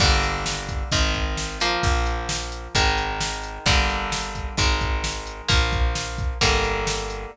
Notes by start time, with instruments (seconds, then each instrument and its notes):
0.00 electric bass (finger) G1, overdriven guitar D3 G3 A#3, kick, crash
0.23 closed hi-hat
0.46 snare
0.69 kick, closed hi-hat
0.92 electric bass (finger) G#1, overdriven guitar D#3 G#3, kick, closed hi-hat
1.15 kick, closed hi-hat
1.37 snare
1.60 overdriven guitar F3 A#3, closed hi-hat
1.83 electric bass (finger) A#1, kick, closed hi-hat
2.06 closed hi-hat
2.29 snare
2.52 closed hi-hat
2.75 electric bass (finger) G#1, overdriven guitar D#3 G#3, kick, closed hi-hat
2.98 closed hi-hat
3.21 snare
3.43 closed hi-hat
3.66 electric bass (finger) G1, overdriven guitar D3 G3 A#3, kick, closed hi-hat
3.89 closed hi-hat
4.12 snare
4.35 kick, closed hi-hat
4.57 electric bass (finger) G#1, overdriven guitar D#3 G#3, kick, closed hi-hat
4.81 kick, closed hi-hat
5.04 snare
5.27 closed hi-hat
5.48 electric bass (finger) A#1, overdriven guitar F3 A#3, kick, closed hi-hat
5.73 kick, closed hi-hat
5.95 snare
6.18 kick, closed hi-hat
6.41 electric bass (finger) G1, overdriven guitar D3 G3 A#3, kick, closed hi-hat
6.64 closed hi-hat
6.87 snare
7.10 closed hi-hat